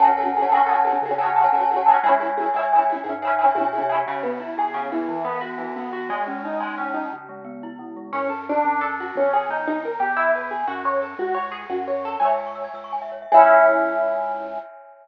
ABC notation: X:1
M:6/8
L:1/16
Q:3/8=118
K:F#m
V:1 name="Overdriven Guitar"
[CFGA]2 [CFGA]2 [CFGA]2 [CFGA]2 [CFGA]2 [CFGA]2 | [CFGA]2 [CFGA]2 [CFGA]2 [CFGA]2 [CFGA]2 [CFGA]2 | [CEG]2 [CEG]2 [CEG]2 [CEG]2 [CEG]2 [CEG]2 | [CEG]2 [CEG]2 [CEG]2 [CEG]2 [CEG]2 [CEG]2 |
[K:C#m] C,2 B,2 E2 G2 C,2 E,2- | E,2 B,2 F2 E,2 B,2 F2 | G,2 C2 D2 G,2 C2 D2 | z12 |
[K:F#m] C2 A2 D4 A2 F2 | C2 G2 ^D2 D2 ^A2 =G2 | E2 B2 G2 F2 c2 A2 | F2 c2 G2 F2 c2 A2 |
[K:C#m] "^rit." [ceg]12 | [CEG]12 |]
V:2 name="Glockenspiel"
[cfga]2 [cfga]3 [cfga] [cfga] [cfga]2 [cfga]3- | [cfga]2 [cfga]3 [cfga] [cfga] [cfga]2 [cfga]3 | [ceg]2 [ceg]3 [ceg] [ceg] [ceg]2 [ceg]3- | [ceg]2 [ceg]3 [ceg] [ceg] [ceg]2 [ceg]3 |
[K:C#m] C,2 B,2 E2 G2 C,2 B,2 | E,2 B,2 F2 E,2 B,2 F2 | G,2 C2 D2 G,2 C2 D2 | C,2 G,2 B,2 E2 C,2 G,2 |
[K:F#m] z12 | z12 | z12 | z12 |
[K:C#m] "^rit." c e g c' e' g' e' c' g e c e | [ceg]12 |]
V:3 name="Synth Bass 1" clef=bass
F,,6 F,,6 | C,6 F,,6 | C,,6 C,,6 | G,,6 B,,3 =C,3 |
[K:C#m] z12 | z12 | z12 | z12 |
[K:F#m] F,,6 F,,6 | G,,,4 =G,,,6 E,,2- | E,,6 F,,6 | C,,6 F,,6 |
[K:C#m] "^rit." C,,6 C,,6 | C,,12 |]